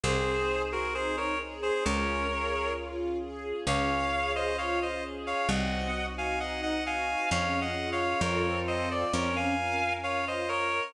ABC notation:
X:1
M:4/4
L:1/16
Q:1/4=66
K:Db
V:1 name="Clarinet"
[Ac]3 [GB] [Ac] [Bd] z [Ac] [Bd]4 z4 | [df]3 [ce] [df] [ce] z [df] [eg]3 [fa] [eg] [eg] [fa]2 | (3[df]2 [eg]2 [df]2 [Bd]2 [ce] =d [B_d] [fa]3 [df] [ce] [Bd]2 |]
V:2 name="String Ensemble 1"
C2 A2 E2 A2 D2 A2 F2 A2 | D2 A2 F2 A2 C2 G2 E2 G2 | D2 F2 [CF=A]4 D2 B2 F2 B2 |]
V:3 name="Electric Bass (finger)" clef=bass
C,,8 D,,8 | D,,8 C,,8 | F,,4 F,,4 F,,8 |]
V:4 name="String Ensemble 1"
[CEA]8 [DFA]8 | [DFA]8 [CEG]8 | [DFA]4 [CF=A]4 [DFB]8 |]